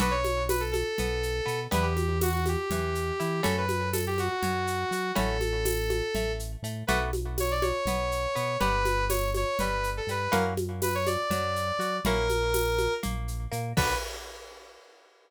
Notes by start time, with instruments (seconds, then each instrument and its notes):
0.00 synth bass 1 B1, pizzicato strings B3 D4 F#4 A4, lead 2 (sawtooth) B4, low conga, shaker
0.11 lead 2 (sawtooth) C#5
0.24 high conga, shaker
0.49 lead 2 (sawtooth) B4, tambourine, high conga, shaker
0.60 lead 2 (sawtooth) A4
0.72 lead 2 (sawtooth) A4, high conga, shaker
0.98 synth bass 1 B1, pizzicato strings B3, low conga, shaker
1.23 shaker
1.46 synth bass 1 B2, pizzicato strings B3, shaker
1.71 synth bass 1 E2, pizzicato strings B3 D4 E4 G4, lead 2 (sawtooth) B4, low conga, shaker
1.82 lead 2 (sawtooth) G4
1.97 high conga, shaker
2.21 lead 2 (sawtooth) F#4, tambourine, high conga, shaker
2.33 lead 2 (sawtooth) F#4
2.46 lead 2 (sawtooth) G4, high conga, shaker
2.70 synth bass 1 E2, pizzicato strings E3, low conga, shaker
2.95 shaker
3.20 synth bass 1 E3, pizzicato strings E4, shaker
3.43 synth bass 1 F#2, pizzicato strings A3 C#4 E4 F#4, lead 2 (sawtooth) A4, low conga, shaker
3.58 lead 2 (sawtooth) B4
3.69 high conga, shaker
3.93 lead 2 (sawtooth) A4, tambourine, high conga, shaker
4.07 lead 2 (sawtooth) G4
4.18 lead 2 (sawtooth) F#4, high conga, shaker
4.43 synth bass 1 F#2, pizzicato strings F#3, low conga, shaker
4.67 shaker
4.91 synth bass 1 F#3, pizzicato strings F#4, shaker
5.15 synth bass 1 A1, pizzicato strings A3 C#4 E4 F#4, lead 2 (sawtooth) A4, low conga, shaker
5.41 high conga, shaker
5.65 tambourine, high conga, shaker
5.90 high conga, shaker
6.15 synth bass 1 A1, pizzicato strings A3, low conga, shaker
6.39 shaker
6.62 synth bass 1 A2, pizzicato strings A3, shaker
6.87 synth bass 1 B1, pizzicato strings A3 B3 D4 F#4, lead 2 (sawtooth) B4, low conga, shaker
7.13 high conga, shaker
7.38 lead 2 (sawtooth) C#5, tambourine, high conga, shaker
7.51 lead 2 (sawtooth) D5
7.62 lead 2 (sawtooth) C#5, high conga, shaker
7.85 synth bass 1 B1, pizzicato strings B3, low conga, shaker
8.12 shaker
8.35 synth bass 1 B2, pizzicato strings B3, shaker
8.60 synth bass 1 G1, pizzicato strings B3 D4 G4, lead 2 (sawtooth) B4, low conga, shaker
8.85 high conga, shaker
9.10 lead 2 (sawtooth) C#5, tambourine, high conga, shaker
9.34 lead 2 (sawtooth) C#5, high conga, shaker
9.59 synth bass 1 G1, pizzicato strings G3, lead 2 (sawtooth) B4, low conga, shaker
9.84 shaker
9.97 lead 2 (sawtooth) A4
10.07 synth bass 1 G2, pizzicato strings G3, lead 2 (sawtooth) B4, shaker
10.32 synth bass 1 F#2, pizzicato strings A#3 C#4 E4 F#4, lead 2 (sawtooth) A#4, low conga, shaker
10.57 high conga, shaker
10.82 lead 2 (sawtooth) B4, tambourine, high conga, shaker
10.95 lead 2 (sawtooth) C#5
11.07 lead 2 (sawtooth) D5, high conga, shaker
11.30 synth bass 1 F#2, pizzicato strings F#3, low conga, shaker
11.56 shaker
11.79 synth bass 1 F#3, pizzicato strings F#4, shaker
12.04 synth bass 1 A#1, pizzicato strings A#3 C#4 E4 F#4, lead 2 (sawtooth) A#4, low conga, shaker
12.29 high conga, shaker
12.54 tambourine, high conga, shaker
12.78 high conga, shaker
13.03 synth bass 1 A#1, pizzicato strings A#3, low conga, shaker
13.28 shaker
13.52 synth bass 1 A#2, pizzicato strings A#3, shaker
13.77 synth bass 1 B1, pizzicato strings B3 D4 F#4 A4, lead 2 (sawtooth) B4, kick, crash